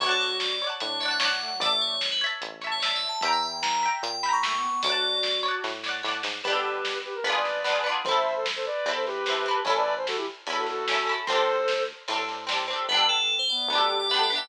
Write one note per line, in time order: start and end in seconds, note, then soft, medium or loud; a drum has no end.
0.00 0.64 D2 medium
0.00 0.55 F#4 medium
0.00 0.10 C#5 loud
0.00 0.57 C#5 loud
0.00 0.57 D5 loud
0.00 kick loud
0.00 crash medium
0.06 0.20 A4 medium
0.06 0.57 F#5 loud
0.06 0.57 A5 loud
0.20 0.36 C#5 medium
0.40 0.65 D5 medium
0.40 snare medium
0.62 0.99 C#5 medium
0.62 0.99 D5 medium
0.67 0.99 F#5 medium
0.67 0.99 A5 medium
0.80 1.46 A2 medium
0.80 1.29 D4 medium
0.80 0.99 C#5 medium
0.80 closed hi-hat medium
1.00 1.19 C#5 medium
1.00 1.19 D5 medium
1.00 1.10 E5 medium
1.00 snare soft
1.06 1.19 F#5 medium
1.06 1.19 A5 medium
1.11 1.20 F#5 medium
1.20 1.57 C#5 medium
1.20 1.57 D5 loud
1.20 1.57 F#5 medium
1.20 snare loud
1.25 1.57 F#5 medium
1.25 1.57 A5 medium
1.41 1.50 A3 medium
1.51 1.61 F#3 medium
1.60 2.24 A1 medium
1.60 1.96 A3 medium
1.60 2.16 D5 loud
1.60 1.81 D5 loud
1.60 2.16 E5 loud
1.60 kick loud
1.60 closed hi-hat medium
1.66 2.16 A5 medium
1.81 2.08 C#5 medium
2.01 snare medium
2.11 2.21 B4 medium
2.21 2.60 C#5 loud
2.21 2.60 E5 loud
2.27 2.60 A5 loud
2.41 3.06 A1 medium
2.41 closed hi-hat medium
2.61 2.80 C#5 medium
2.61 2.80 E5 medium
2.61 snare medium
2.67 2.80 A5 medium
2.72 2.81 C#5 medium
2.80 3.17 C#5 medium
2.80 2.94 D5 medium
2.80 3.17 E5 medium
2.80 snare loud
2.85 3.17 A5 medium
2.95 3.08 E5 medium
3.09 3.22 A5 medium
3.21 3.87 E2 medium
3.21 3.41 E3 medium
3.21 3.78 E5 loud
3.21 3.32 G5 loud
3.21 kick loud
3.21 closed hi-hat loud
3.25 3.78 G5 loud
3.25 3.78 A#5 loud
3.32 3.42 E5 medium
3.42 3.61 E3 medium
3.42 3.61 G5 medium
3.62 3.87 E3 medium
3.62 3.89 A#5 medium
3.62 snare loud
3.83 4.20 E5 medium
3.83 4.20 G5 medium
3.88 4.20 A#5 medium
4.03 4.67 A#2 medium
4.03 4.22 G5 medium
4.03 closed hi-hat medium
4.23 4.42 E5 medium
4.23 4.42 G5 medium
4.23 4.32 B5 medium
4.23 snare medium
4.29 4.42 A#5 medium
4.33 4.42 C#6 medium
4.43 4.56 A3 medium
4.43 4.80 E5 medium
4.43 4.80 G5 medium
4.43 4.80 C#6 medium
4.43 snare loud
4.48 4.80 A#5 medium
4.57 4.69 B3 medium
4.70 4.82 B3 medium
4.83 5.48 D2 medium
4.83 5.70 F#4 medium
4.83 5.40 C#5 loud
4.83 5.36 D5 loud
4.83 kick loud
4.83 closed hi-hat loud
4.87 5.40 D5 loud
4.87 5.40 F#5 loud
4.92 5.40 A5 loud
5.23 snare medium
5.43 5.80 C#5 medium
5.43 5.80 D5 medium
5.48 5.80 F#5 medium
5.48 5.80 A5 medium
5.64 6.02 A2 medium
5.64 kick medium
5.64 snare medium
5.83 6.02 C#5 medium
5.83 6.02 D5 medium
5.83 snare medium
5.89 6.02 F#5 loud
5.89 6.02 A5 medium
6.03 6.22 A2 medium
6.03 6.40 C#5 medium
6.03 6.40 D5 medium
6.03 snare medium
6.09 6.40 F#5 loud
6.09 6.40 A5 medium
6.23 6.42 G#2 medium
6.23 snare loud
6.43 7.08 G1 medium
6.43 7.19 B3 loud
6.43 6.53 G4 medium
6.43 6.53 B4 loud
6.43 kick medium
6.43 crash medium
6.48 7.19 D4 loud
6.48 7.19 G4 loud
6.53 6.98 G4 medium
6.53 7.19 A4 medium
6.53 6.98 B4 medium
6.85 snare medium
7.05 7.14 G4 medium
7.05 7.14 B4 medium
7.15 7.24 A#4 medium
7.23 7.88 G#1 medium
7.23 7.61 B3 loud
7.23 7.61 D4 loud
7.23 7.34 G#4 medium
7.23 7.34 B4 medium
7.23 ride medium
7.30 7.61 F4 loud
7.30 7.61 G#4 loud
7.36 7.88 B4 medium
7.36 7.88 D5 medium
7.45 snare medium
7.64 7.83 B3 medium
7.64 7.83 D4 medium
7.64 snare medium
7.70 7.83 F4 medium
7.70 7.83 G#4 medium
7.84 8.02 B3 medium
7.84 8.02 D4 loud
7.89 8.02 F4 medium
7.89 8.02 G#4 medium
8.04 8.69 A1 medium
8.04 8.80 C4 medium
8.04 8.15 A4 medium
8.04 8.15 C5 medium
8.04 kick loud
8.04 ride medium
8.09 8.80 E4 loud
8.09 8.80 A4 loud
8.15 8.35 C5 medium
8.15 8.35 E5 medium
8.36 8.45 A4 medium
8.36 8.45 C5 medium
8.46 snare loud
8.56 8.65 A4 medium
8.56 8.65 C5 medium
8.66 8.90 B4 medium
8.66 8.90 D5 medium
8.86 9.50 E2 medium
8.86 9.23 C4 loud
8.86 9.23 E4 medium
8.86 ride medium
8.91 9.23 A4 medium
8.96 9.05 A4 medium
8.96 9.05 C5 medium
9.06 9.60 G4 medium
9.06 9.60 B4 medium
9.06 snare soft
9.26 9.45 C4 medium
9.26 9.45 E4 medium
9.26 snare medium
9.32 9.45 A4 medium
9.46 9.64 C4 medium
9.46 9.64 E4 medium
9.51 9.64 A4 medium
9.65 10.30 A1 medium
9.65 10.39 C#4 medium
9.65 10.39 E4 loud
9.65 9.76 A4 medium
9.65 9.76 C#5 loud
9.65 kick medium
9.65 ride medium
9.70 10.39 A4 loud
9.76 9.94 B4 medium
9.76 9.94 D5 loud
9.97 10.06 C5 medium
10.07 10.16 F#4 medium
10.07 10.16 A4 medium
10.07 snare medium
10.16 10.26 E4 medium
10.16 10.26 G4 medium
10.47 11.11 E2 medium
10.47 10.84 C#4 medium
10.47 10.84 E4 medium
10.47 ride medium
10.53 10.84 A4 medium
10.57 10.66 F#4 medium
10.57 10.66 A4 medium
10.67 11.16 F#4 medium
10.67 11.16 A4 medium
10.67 snare medium
10.88 11.06 C#4 medium
10.88 snare loud
10.92 11.08 E4 medium
10.92 11.08 A4 medium
11.07 11.25 C#4 medium
11.07 11.25 E4 medium
11.12 11.25 A4 medium
11.27 11.93 D2 medium
11.27 12.01 C4 loud
11.27 12.01 D4 loud
11.27 11.84 A4 medium
11.27 11.84 C5 loud
11.27 kick medium
11.27 ride medium
11.33 12.01 G4 loud
11.33 12.01 A4 loud
11.68 snare medium
12.08 12.73 A2 medium
12.08 12.45 C4 medium
12.08 12.45 D4 medium
12.08 ride loud
12.13 12.45 G4 medium
12.13 12.45 A4 medium
12.28 snare medium
12.47 12.65 C4 medium
12.47 12.65 D4 medium
12.47 snare loud
12.52 12.65 G4 medium
12.52 12.65 A4 medium
12.68 12.86 C4 medium
12.68 12.86 D4 medium
12.73 12.86 G4 medium
12.73 12.86 A4 medium
12.89 13.53 G1 medium
12.89 13.07 G3 medium
12.89 13.63 B3 loud
12.89 13.63 D4 loud
12.89 13.06 B4 loud
12.94 13.63 G4 loud
12.94 13.63 A4 loud
13.09 13.35 A4 loud
13.39 13.48 C5 loud
13.49 13.69 B3 medium
13.49 13.96 D5 medium
13.68 14.33 D2 medium
13.68 14.07 B3 medium
13.68 13.89 D4 medium
13.73 14.07 D4 medium
13.73 14.07 G4 loud
13.78 14.07 A4 loud
13.89 14.23 G4 medium
13.99 14.09 D5 loud
14.09 14.30 B3 loud
14.09 14.22 E5 loud
14.14 14.30 D4 medium
14.14 14.30 G4 loud
14.19 14.30 A4 medium
14.19 14.36 D5 medium
14.30 14.49 B3 medium
14.30 14.40 D4 medium
14.30 14.49 D4 medium
14.35 14.49 G4 loud
14.35 14.49 A4 medium
14.35 14.49 E5 loud